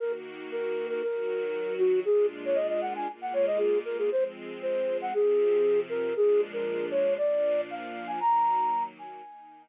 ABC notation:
X:1
M:4/4
L:1/16
Q:1/4=117
K:Ebdor
V:1 name="Flute"
B z3 B3 B B6 G2 | A2 z d e e g a z g d e A2 B A | c z3 c3 g A6 B2 | A2 z B3 ^c2 =d4 f3 a |
b6 a6 z4 |]
V:2 name="String Ensemble 1"
[E,B,G]8 [E,G,G]8 | [B,,A,=DF]8 [B,,A,B,F]8 | [F,A,C]8 [C,F,C]8 | [B,,F,A,=D]8 [B,,F,B,D]8 |
[E,G,B,]8 [E,B,E]8 |]